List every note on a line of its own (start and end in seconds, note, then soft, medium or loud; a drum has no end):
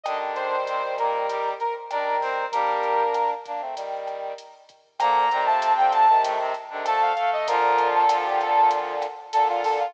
0.03 0.56 D3 medium
0.03 1.54 D#3 medium
0.03 1.54 G3 medium
0.03 0.56 D4 loud
0.03 0.18 D#5 medium
0.03 kick medium
0.03 cross-stick loud
0.03 closed hi-hat medium
0.35 0.95 C5 medium
0.35 closed hi-hat medium
0.67 0.82 C3 medium
0.67 0.82 C4 medium
0.67 closed hi-hat medium
0.98 1.26 A#2 medium
0.98 1.26 A#3 medium
0.98 1.49 A#4 medium
0.98 kick medium
0.98 cross-stick medium
0.98 closed hi-hat medium
1.28 1.54 G3 medium
1.28 1.54 G4 medium
1.28 kick medium
1.28 closed hi-hat medium
1.60 1.74 A#4 medium
1.60 closed hi-hat medium
1.90 2.45 D#3 medium
1.90 2.45 G3 medium
1.90 2.17 D4 medium
1.90 2.45 A#4 medium
1.90 2.17 D5 loud
1.90 cross-stick medium
1.90 closed hi-hat medium
2.21 2.46 C4 medium
2.21 2.46 C5 loud
2.21 kick medium
2.21 open hi-hat medium
2.52 3.03 G3 medium
2.52 3.34 A#3 medium
2.52 3.34 D4 medium
2.52 3.03 G4 loud
2.52 3.30 A#4 medium
2.52 kick medium
2.52 closed hi-hat loud
2.83 closed hi-hat medium
3.14 cross-stick medium
3.14 closed hi-hat medium
3.46 3.61 A#3 medium
3.46 3.61 D4 medium
3.46 kick medium
3.46 closed hi-hat medium
3.60 3.75 A3 medium
3.60 3.75 C4 medium
3.76 4.33 D#3 medium
3.76 4.33 G3 medium
3.76 kick medium
3.76 closed hi-hat loud
4.07 cross-stick medium
4.07 closed hi-hat medium
4.38 closed hi-hat medium
4.69 kick medium
4.69 closed hi-hat medium
4.99 5.29 A#2 loud
4.99 5.25 D3 medium
4.99 5.25 F3 medium
4.99 5.29 A#3 loud
4.99 5.44 A#5 medium
4.99 kick medium
4.99 cross-stick loud
4.99 closed hi-hat loud
5.31 6.08 C3 loud
5.31 5.47 D#3 medium
5.31 5.47 G3 medium
5.31 6.08 C4 loud
5.31 closed hi-hat medium
5.46 5.73 F3 medium
5.46 5.73 A3 medium
5.46 5.73 A5 medium
5.62 closed hi-hat loud
5.77 6.06 D3 medium
5.77 6.06 F3 medium
5.77 5.92 G5 medium
5.92 6.22 A5 medium
5.92 kick medium
5.92 cross-stick medium
5.92 closed hi-hat medium
6.09 6.53 C3 medium
6.09 6.53 D#3 loud
6.23 6.38 A2 medium
6.23 6.38 A3 loud
6.23 kick medium
6.23 closed hi-hat loud
6.39 6.54 C3 medium
6.39 6.54 C4 loud
6.54 closed hi-hat medium
6.70 6.86 C3 medium
6.70 6.85 D3 medium
6.70 6.86 D#3 medium
6.70 6.85 D4 loud
6.85 7.13 D3 medium
6.85 7.13 F3 medium
6.85 7.12 A3 loud
6.85 7.12 A4 loud
6.85 7.01 A5 medium
6.85 cross-stick loud
6.85 closed hi-hat loud
7.02 7.15 F5 medium
7.16 7.47 A3 medium
7.16 7.47 A4 loud
7.16 7.30 F5 medium
7.16 kick medium
7.16 closed hi-hat medium
7.33 7.48 D#5 medium
7.47 9.06 A#2 medium
7.47 9.06 D3 loud
7.47 8.04 F3 loud
7.47 8.04 F4 loud
7.47 7.88 A#4 medium
7.47 kick loud
7.47 closed hi-hat loud
7.78 closed hi-hat medium
7.95 8.25 A4 medium
8.09 8.95 F3 medium
8.09 8.95 F4 loud
8.09 cross-stick loud
8.09 closed hi-hat loud
8.25 8.39 G4 medium
8.40 8.69 A4 medium
8.40 kick loud
8.40 closed hi-hat medium
8.71 kick medium
8.71 closed hi-hat loud
9.02 cross-stick medium
9.02 closed hi-hat medium
9.33 9.86 A#2 medium
9.33 9.86 D3 loud
9.33 9.48 A4 loud
9.33 closed hi-hat loud
9.49 9.63 F4 medium
9.64 9.78 A4 medium
9.64 kick medium
9.64 open hi-hat medium
9.79 9.94 F4 medium